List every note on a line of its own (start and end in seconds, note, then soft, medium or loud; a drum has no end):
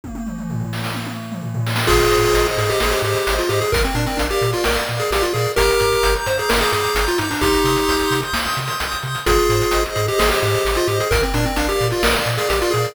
0.04 kick medium
0.04 high tom medium
0.15 high tom medium
0.26 mid tom medium
0.38 mid tom medium
0.50 floor tom medium
0.60 floor tom medium
0.73 snare medium
0.84 snare medium
0.94 high tom medium
1.06 high tom medium
1.32 mid tom medium
1.42 floor tom medium
1.54 floor tom medium
1.66 snare medium
1.76 snare medium
1.87 2.02 G#1 medium
1.87 2.47 F4 medium
1.87 2.47 G#4 medium
1.87 2.57 G#4 loud
1.87 kick loud
1.87 crash medium
1.99 closed hi-hat medium
2.10 2.25 G#2 medium
2.10 2.80 C5 medium
2.10 closed hi-hat medium
2.22 closed hi-hat medium
2.34 2.47 G#1 medium
2.34 3.03 D#5 medium
2.34 closed hi-hat medium
2.46 closed hi-hat medium
2.57 2.70 G#2 medium
2.57 3.26 G#4 medium
2.57 2.69 G#4 medium
2.57 closed hi-hat medium
2.69 2.80 G4 medium
2.69 closed hi-hat medium
2.80 2.94 G#1 medium
2.80 2.93 G#4 medium
2.80 3.49 C5 medium
2.80 snare medium
2.91 3.02 G4 medium
2.91 closed hi-hat medium
3.02 3.15 G#2 medium
3.02 3.34 G4 medium
3.02 3.69 D#5 medium
3.02 closed hi-hat medium
3.16 closed hi-hat medium
3.27 3.40 G#1 medium
3.27 3.70 G#4 medium
3.27 closed hi-hat loud
3.38 3.50 F4 medium
3.38 closed hi-hat medium
3.49 3.62 G#2 medium
3.49 3.60 G4 medium
3.49 3.72 C5 medium
3.49 closed hi-hat medium
3.61 3.72 G#4 medium
3.61 closed hi-hat medium
3.72 3.85 A#1 medium
3.72 3.83 A#4 medium
3.72 4.41 A#4 loud
3.72 kick loud
3.72 closed hi-hat loud
3.84 3.95 C4 medium
3.84 closed hi-hat medium
3.95 4.07 A#2 medium
3.95 4.06 D4 medium
3.95 4.64 D5 medium
3.95 closed hi-hat medium
4.06 4.18 C4 medium
4.06 closed hi-hat medium
4.17 4.31 A#1 medium
4.17 4.28 D4 medium
4.17 4.87 F5 medium
4.17 closed hi-hat medium
4.30 4.51 G4 medium
4.30 closed hi-hat medium
4.41 4.54 A#2 medium
4.41 5.10 A#4 medium
4.41 closed hi-hat medium
4.53 4.64 F4 medium
4.53 closed hi-hat medium
4.64 4.78 A#1 medium
4.64 4.76 A#4 medium
4.64 5.34 D5 medium
4.64 snare loud
4.76 closed hi-hat medium
4.88 5.02 A#2 medium
4.88 5.54 F5 medium
4.88 closed hi-hat medium
5.00 5.11 G#4 medium
5.00 closed hi-hat medium
5.11 5.23 A#1 medium
5.11 5.23 G4 medium
5.11 5.55 A#4 medium
5.11 closed hi-hat medium
5.22 5.33 F4 medium
5.22 closed hi-hat medium
5.33 5.47 A#2 medium
5.33 5.52 G#4 medium
5.33 5.56 D5 medium
5.33 closed hi-hat medium
5.44 closed hi-hat medium
5.56 5.70 G1 medium
5.56 6.15 G4 medium
5.56 6.15 A#4 medium
5.56 6.26 A#5 loud
5.56 kick medium
5.56 closed hi-hat medium
5.70 closed hi-hat medium
5.80 5.94 G2 medium
5.80 6.49 D6 medium
5.80 closed hi-hat medium
5.92 closed hi-hat medium
6.03 6.16 G1 medium
6.03 6.72 G6 medium
6.03 closed hi-hat medium
6.16 closed hi-hat medium
6.26 6.39 G2 medium
6.26 6.38 C5 medium
6.26 6.95 A#5 medium
6.26 closed hi-hat medium
6.38 6.50 G#4 medium
6.38 closed hi-hat medium
6.49 6.63 G1 medium
6.49 6.60 A#4 medium
6.49 7.18 D6 medium
6.49 snare loud
6.61 6.72 G#4 medium
6.61 closed hi-hat medium
6.72 6.85 G2 medium
6.72 7.05 G#4 medium
6.72 7.38 G6 medium
6.72 closed hi-hat medium
6.85 closed hi-hat medium
6.95 7.07 G1 medium
6.95 7.39 A#5 medium
6.95 closed hi-hat loud
7.07 7.19 F4 medium
7.07 closed hi-hat medium
7.18 7.32 G2 medium
7.18 7.30 D#4 medium
7.18 7.41 D6 medium
7.18 closed hi-hat medium
7.30 7.41 D4 medium
7.30 open hi-hat medium
7.41 7.54 C2 medium
7.41 8.21 D#4 medium
7.41 8.21 G4 medium
7.41 8.11 C6 loud
7.41 kick medium
7.41 closed hi-hat medium
7.54 closed hi-hat medium
7.64 7.77 C3 medium
7.64 8.34 D#6 medium
7.64 closed hi-hat medium
7.76 closed hi-hat medium
7.88 8.01 C2 medium
7.88 8.57 G6 medium
7.88 closed hi-hat medium
7.99 closed hi-hat medium
8.11 8.23 C3 medium
8.11 8.80 C6 medium
8.11 closed hi-hat medium
8.22 closed hi-hat medium
8.33 8.46 C2 medium
8.33 9.03 D#6 medium
8.33 snare medium
8.45 closed hi-hat medium
8.57 8.70 C3 medium
8.57 9.23 G6 medium
8.57 closed hi-hat medium
8.68 closed hi-hat medium
8.80 8.93 C2 medium
8.80 9.24 C6 medium
8.80 closed hi-hat medium
8.92 closed hi-hat medium
9.02 9.16 C3 medium
9.02 9.25 D#6 medium
9.02 closed hi-hat medium
9.15 closed hi-hat medium
9.26 9.39 G#1 medium
9.26 9.84 F4 medium
9.26 9.84 G#4 medium
9.26 9.95 G#4 loud
9.26 kick medium
9.26 closed hi-hat medium
9.39 closed hi-hat medium
9.49 9.62 G#2 medium
9.49 10.18 C5 medium
9.49 closed hi-hat medium
9.62 closed hi-hat medium
9.71 9.86 G#1 medium
9.71 10.41 D#5 medium
9.71 closed hi-hat medium
9.86 closed hi-hat medium
9.95 10.09 G#2 medium
9.95 10.06 G#4 medium
9.95 10.65 G#4 medium
9.95 closed hi-hat medium
10.08 10.19 G4 medium
10.08 closed hi-hat medium
10.18 10.32 G#1 medium
10.18 10.29 G#4 medium
10.18 10.87 C5 medium
10.18 snare loud
10.30 10.41 G4 medium
10.30 closed hi-hat medium
10.42 10.55 G#2 medium
10.42 10.76 G4 medium
10.42 11.08 D#5 medium
10.42 closed hi-hat medium
10.54 closed hi-hat medium
10.65 10.78 G#1 medium
10.65 11.09 G#4 medium
10.65 closed hi-hat medium
10.75 10.88 F4 medium
10.75 closed hi-hat medium
10.87 11.00 G#2 medium
10.87 10.98 G4 medium
10.87 11.10 C5 medium
10.87 closed hi-hat medium
11.00 11.11 G#4 medium
11.00 closed hi-hat medium
11.11 11.24 A#1 medium
11.11 11.22 A#4 medium
11.11 11.80 A#4 loud
11.11 kick loud
11.11 closed hi-hat medium
11.22 11.34 C4 medium
11.22 closed hi-hat medium
11.34 11.47 A#2 medium
11.34 11.45 D4 medium
11.34 12.03 D5 medium
11.34 closed hi-hat medium
11.45 11.57 C4 medium
11.45 closed hi-hat medium
11.56 11.70 A#1 medium
11.56 11.68 D4 medium
11.56 12.26 F5 medium
11.56 closed hi-hat medium
11.69 11.88 G4 medium
11.69 closed hi-hat medium
11.80 11.93 A#2 medium
11.80 12.49 A#4 medium
11.80 closed hi-hat medium
11.90 12.03 F4 medium
11.90 closed hi-hat medium
12.03 12.15 A#1 medium
12.03 12.15 A#4 medium
12.03 12.72 D5 loud
12.03 snare loud
12.15 closed hi-hat medium
12.26 12.39 A#2 medium
12.26 12.92 F5 medium
12.26 closed hi-hat medium
12.37 12.48 G#4 medium
12.37 closed hi-hat medium
12.49 12.63 A#1 medium
12.49 12.60 G4 medium
12.49 12.94 A#4 medium
12.49 closed hi-hat medium
12.61 12.73 F4 medium
12.61 closed hi-hat medium
12.71 12.87 A#2 medium
12.71 12.93 G#4 medium
12.71 12.95 D5 medium
12.71 closed hi-hat medium
12.84 closed hi-hat medium